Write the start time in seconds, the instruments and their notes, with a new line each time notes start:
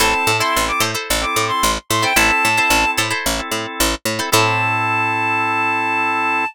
0.00 electric bass (finger) A1, drawbar organ C4 E4 A4, pizzicato strings E4 A4 C5, clarinet A5
0.27 electric bass (finger) A2
0.40 drawbar organ C4 E4 A4, pizzicato strings E4 A4 C5, clarinet C6
0.56 electric bass (finger) A1
0.68 clarinet D6
0.80 electric bass (finger) A2, pizzicato strings E4 A4 C5
0.95 pizzicato strings E4 A4 C5
1.10 electric bass (finger) A1
1.21 drawbar organ C4 E4 A4, clarinet D6
1.36 electric bass (finger) A2
1.48 clarinet C6
1.63 electric bass (finger) A1
1.90 electric bass (finger) A2, clarinet C6
2.02 drawbar organ C4 E4 A4, pizzicato strings E4 A4 C5, clarinet G5
2.16 electric bass (finger) A1, drawbar organ C4 E4 A4, pizzicato strings E4 A4 C5, clarinet A5
2.45 electric bass (finger) A2
2.57 drawbar organ C4 E4 A4, pizzicato strings E4 A4 C5
2.70 electric bass (finger) A1
2.97 electric bass (finger) A2, pizzicato strings E4 A4 C5
3.10 pizzicato strings E4 A4 C5
3.26 electric bass (finger) A1
3.39 drawbar organ C4 E4 A4
3.51 electric bass (finger) A2
3.80 electric bass (finger) A1
4.05 electric bass (finger) A2
4.19 drawbar organ C4 E4 A4, pizzicato strings E4 A4 C5
4.32 electric bass (finger) A2, drawbar organ C4 E4 A4, pizzicato strings E4 A4 C5, clarinet A5